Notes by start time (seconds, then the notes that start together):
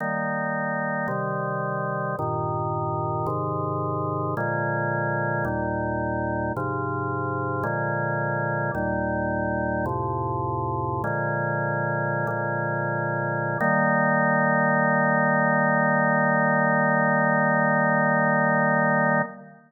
0.00 D#3 G3 A#3
1.08 C3 D#3 G3
2.19 G2 A#2 D#3
3.27 G#2 C3 D#3
4.37 A#2 D3 F3 G#3
5.45 D#2 A#2 G3
6.57 G#2 C3 F3
7.63 A#2 D3 F3 G#3
8.75 D#2 A#2 G3
9.86 F2 A2 C3
11.04 A#2 D3 F3 G#3
12.27 A#2 D3 F3 G#3
13.60 D#3 G3 A#3